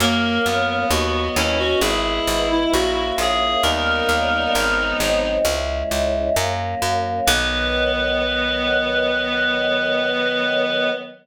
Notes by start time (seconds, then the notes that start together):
0.00 F#2 F#3 A#3 C#4 A#4
0.46 F#2 B3
0.90 D#2 F#3 B3 D#4 F#4
1.36 D#2 C#4 E4
1.59 F#4
1.80 G#1 G#3 B3 E4 G#4
2.27 G#1
2.51 E4
2.73 A#1 A#3 C#4 E4 F#4
3.18 A#1 G#4
3.62 D#2 G3 A#3 B3 C#4 D#4 A#4
4.09 D#2
4.55 G#1 F#3 G#3 C4 D#4
5.00 G#1
5.45 C#2 G#3 C#4 E4
5.91 C#2
6.36 F#2 F#3 A#3 C#4
6.82 F#2
7.27 B1 D#3 F#3 B3 B4